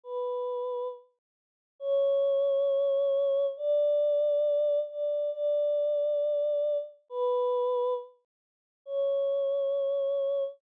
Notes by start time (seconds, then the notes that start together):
0.04 B4
1.80 C#5
3.57 D5
4.90 D5
5.32 D5
7.10 B4
8.86 C#5